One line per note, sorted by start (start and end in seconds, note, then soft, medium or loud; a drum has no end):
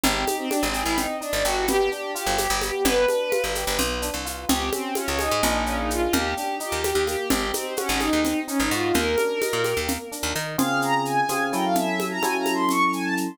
0.04 0.25 G#1 loud
0.04 0.25 C4 loud
0.04 0.35 G4 medium
0.04 low conga medium
0.04 shaker medium
0.27 0.48 D#4 medium
0.27 high conga medium
0.27 shaker medium
0.38 0.49 C4 medium
0.49 0.64 D4 medium
0.49 0.72 G4 medium
0.49 high conga medium
0.49 shaker medium
0.63 0.84 G#1 medium
0.63 0.81 C4 medium
0.74 0.96 G#4 medium
0.74 shaker medium
0.82 1.07 G#1 medium
0.82 0.97 E4 medium
0.96 1.19 C4 medium
0.96 1.16 D#4 medium
0.96 low conga medium
0.96 shaker medium
1.21 1.32 D4 medium
1.21 1.42 D#4 medium
1.21 shaker soft
1.33 1.43 G#1 medium
1.33 1.44 D4 medium
1.44 1.89 G1 medium
1.44 1.65 F#4 medium
1.44 1.66 G4 medium
1.44 shaker medium
1.68 1.89 B3 loud
1.68 1.90 G4 loud
1.68 low conga medium
1.68 shaker medium
1.90 2.13 D4 medium
1.90 2.11 G4 medium
1.90 shaker soft
2.15 2.36 F4 medium
2.15 2.37 G4 medium
2.15 shaker medium
2.26 2.48 G1 medium
2.38 2.57 G4 medium
2.38 2.59 G4 medium
2.38 high conga medium
2.38 shaker medium
2.50 2.71 G1 medium
2.61 2.83 B3 medium
2.61 2.83 G4 medium
2.61 high conga medium
2.61 shaker medium
2.84 3.06 G1 loud
2.84 3.06 B3 loud
2.84 3.43 B4 loud
2.84 low conga medium
2.84 shaker medium
3.08 3.30 D4 medium
3.08 high conga medium
3.08 shaker medium
3.32 3.53 F4 medium
3.32 high conga medium
3.32 shaker medium
3.44 3.65 G1 medium
3.55 3.77 G4 medium
3.55 high conga soft
3.55 shaker medium
3.67 3.78 G1 medium
3.79 4.10 B1 medium
3.79 4.00 B3 medium
3.79 low conga medium
3.79 shaker medium
4.02 4.23 D4 medium
4.02 shaker medium
4.14 4.45 C2 medium
4.25 4.46 F4 medium
4.25 shaker medium
4.49 4.70 C#2 loud
4.49 4.70 C4 loud
4.49 4.70 G4 medium
4.49 low conga medium
4.49 shaker medium
4.72 4.93 C4 medium
4.72 4.94 C#4 medium
4.72 high conga medium
4.72 shaker medium
4.95 5.07 C#4 medium
4.95 5.18 F4 medium
4.95 high conga medium
4.95 shaker medium
5.07 5.29 C#2 medium
5.07 5.18 C#4 medium
5.19 5.64 D#4 medium
5.19 5.41 G#4 medium
5.19 high conga medium
5.19 shaker medium
5.31 5.42 G#2 medium
5.43 6.08 A#1 loud
5.43 6.06 A#3 loud
5.43 6.06 D4 loud
5.43 6.06 F4 loud
5.43 6.06 G#4 loud
5.43 low conga medium
5.43 shaker medium
5.66 5.77 C#4 loud
5.66 shaker medium
5.78 5.89 D#4 medium
5.90 6.13 F4 medium
5.90 shaker medium
6.13 6.34 D#2 loud
6.13 6.34 A#3 medium
6.13 6.34 G4 loud
6.13 low conga medium
6.35 6.58 D4 medium
6.35 6.55 G4 medium
6.35 shaker medium
6.60 6.81 D#4 medium
6.60 6.82 G4 medium
6.60 shaker medium
6.72 6.93 D#2 medium
6.84 7.04 G4 medium
6.84 7.05 G4 medium
6.84 high conga medium
6.84 shaker medium
6.95 7.16 D#2 medium
7.07 7.28 A#3 medium
7.07 7.28 G4 medium
7.07 high conga medium
7.07 shaker medium
7.30 7.52 G#1 medium
7.30 7.52 C4 medium
7.30 7.49 G4 loud
7.30 low conga medium
7.30 shaker medium
7.54 7.74 C4 medium
7.54 7.75 D#4 medium
7.54 high conga medium
7.54 shaker medium
7.77 7.88 C#4 medium
7.77 7.98 F#4 medium
7.77 high conga medium
7.77 shaker medium
7.88 8.10 G#1 medium
7.88 8.00 C#4 medium
8.00 8.40 D#4 loud
8.00 8.21 G#4 medium
8.00 high conga medium
8.00 shaker medium
8.13 8.34 D#2 medium
8.25 8.46 C4 medium
8.25 low conga medium
8.25 shaker medium
8.47 8.58 C#4 medium
8.47 8.69 D#4 medium
8.47 shaker medium
8.60 8.70 G#1 medium
8.60 8.72 D#4 medium
8.71 8.92 G#2 medium
8.71 8.94 F4 medium
8.71 8.92 F#4 medium
8.71 shaker medium
8.94 9.16 D#2 loud
8.94 9.16 A#3 loud
8.94 9.74 A#4 loud
8.94 low conga medium
8.94 shaker medium
9.18 9.39 D4 medium
9.18 high conga medium
9.18 shaker medium
9.41 9.62 D#4 medium
9.41 high conga medium
9.41 shaker medium
9.53 9.74 A#2 medium
9.64 9.86 G4 medium
9.64 high conga medium
9.64 shaker medium
9.77 9.98 D#2 medium
9.88 10.09 A#3 medium
9.88 low conga medium
9.88 shaker medium
10.12 10.33 D4 medium
10.12 shaker medium
10.23 10.33 D#2 medium
10.35 10.57 D#3 medium
10.35 10.56 D#4 medium
10.35 shaker medium
10.58 11.21 C#3 loud
10.58 11.21 C4 loud
10.58 11.21 F4 loud
10.58 11.21 G#4 loud
10.58 10.81 F5 loud
10.58 low conga medium
10.58 shaker medium
10.82 11.02 A#5 medium
10.82 shaker medium
11.05 11.47 G#5 medium
11.05 shaker medium
11.29 11.52 C#3 medium
11.29 11.52 C4 loud
11.29 11.52 F4 medium
11.29 11.52 G#4 medium
11.29 high conga medium
11.29 shaker medium
11.53 12.19 F#3 loud
11.53 12.19 C#4 loud
11.53 12.19 E4 loud
11.53 12.19 A4 medium
11.53 11.64 G5 medium
11.53 shaker medium
11.64 11.75 F5 medium
11.75 12.05 E5 loud
11.75 low conga medium
11.75 shaker medium
12.00 high conga medium
12.00 shaker medium
12.11 12.22 A#5 medium
12.22 13.28 F#3 loud
12.22 13.28 C#4 loud
12.22 13.28 E4 medium
12.22 13.28 A4 medium
12.22 12.37 G#5 medium
12.22 high conga medium
12.22 shaker medium
12.38 12.53 A#5 medium
12.46 high conga medium
12.46 shaker medium
12.54 12.69 C6 medium
12.69 12.91 C#6 medium
12.69 low conga medium
12.69 shaker medium
12.93 13.04 G#5 medium
12.93 shaker medium
13.03 13.15 A5 medium
13.17 shaker medium